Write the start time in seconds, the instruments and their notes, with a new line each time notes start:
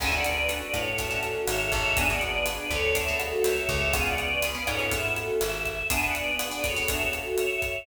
0.00 electric bass (finger) D2, acoustic guitar (steel) C#4 D4 F#4 A4, choir aahs E5 G#5, kick, cross-stick, crash
0.12 acoustic guitar (steel) C#4 D4 F#4 A4, choir aahs D5 F#5
0.24 choir aahs B4 D5, closed hi-hat
0.49 acoustic guitar (steel) C#4 D4 F#4 A4, closed hi-hat
0.62 choir aahs B4 D5
0.74 electric bass (finger) A2, choir aahs A4 C#5, kick, cross-stick, closed hi-hat
0.98 acoustic guitar (steel) C#4 D4 F#4 A4, choir aahs C#5 E5, kick, closed hi-hat
1.11 acoustic guitar (steel) C#4 D4 F#4 A4
1.23 choir aahs F#4 A4, closed hi-hat
1.47 electric bass (finger) G#1, choir aahs C#5 E5, cross-stick, closed hi-hat
1.60 choir aahs C#5 E5
1.72 electric bass (finger) G#1, choir aahs C#5 E5, kick, closed hi-hat
1.96 acoustic guitar (steel) B3 D4 F#4 G#4, choir aahs E5 G#5, kick, closed hi-hat
2.09 acoustic guitar (steel) B3 D4 F#4 G#4, choir aahs D5 F#5
2.21 choir aahs B4 D5, closed hi-hat
2.46 acoustic guitar (steel) B3 D4 F#4 G#4, cross-stick, closed hi-hat
2.58 choir aahs B4 D5
2.70 electric bass (finger) D2, choir aahs A4 C#5, kick, closed hi-hat
2.95 acoustic guitar (steel) B3 D4 F#4 G#4, choir aahs C#5 E5, kick, closed hi-hat
3.08 acoustic guitar (steel) B3 D4 F#4 G#4
3.19 choir aahs F#4 A4, cross-stick, closed hi-hat
3.44 electric bass (finger) C#2, choir aahs C#5 E5, closed hi-hat
3.57 choir aahs C#5 E5
3.69 electric bass (finger) C#2, choir aahs C#5 E5, kick, closed hi-hat
3.93 acoustic guitar (steel) B3 C#4 F4 G#4, choir aahs F5 G#5, kick, cross-stick, closed hi-hat
4.05 choir aahs D5 F#5
4.18 choir aahs B4 D5, closed hi-hat
4.42 acoustic guitar (steel) B3 C#4 F4 G#4, closed hi-hat
4.55 acoustic guitar (steel) B3 C#4 F4 G#4, choir aahs B4 D5
4.67 electric bass (finger) G#2, acoustic guitar (steel) B3 C#4 F4 G#4, choir aahs A4 C#5, kick, cross-stick, closed hi-hat
4.79 acoustic guitar (steel) B3 C#4 F4 G#4
4.91 acoustic guitar (steel) B3 C#4 F4 G#4, choir aahs E5, kick, closed hi-hat
5.16 choir aahs F#4 A4, closed hi-hat
5.41 electric bass (finger) G#1, choir aahs E5, cross-stick, closed hi-hat
5.53 choir aahs E5
5.66 choir aahs E5, kick, closed hi-hat
5.90 acoustic guitar (steel) B3 D4 F#4 G#4, choir aahs E5 G#5, kick, closed hi-hat
6.03 choir aahs D5 F#5
6.14 choir aahs B4 D5, closed hi-hat
6.39 acoustic guitar (steel) B3 D4 F#4 G#4, cross-stick, closed hi-hat
6.51 acoustic guitar (steel) B3 D4 F#4 G#4, choir aahs B4 D5
6.64 acoustic guitar (steel) B3 D4 F#4 G#4, choir aahs A4 C#5, kick, closed hi-hat
6.76 acoustic guitar (steel) B3 D4 F#4 G#4
6.88 acoustic guitar (steel) B3 D4 F#4 G#4, choir aahs C#5 E5, kick, closed hi-hat
7.13 choir aahs F#4 A4, cross-stick, closed hi-hat
7.38 choir aahs C#5 E5, closed hi-hat
7.50 choir aahs C#5 E5
7.62 choir aahs C#5 E5, kick, closed hi-hat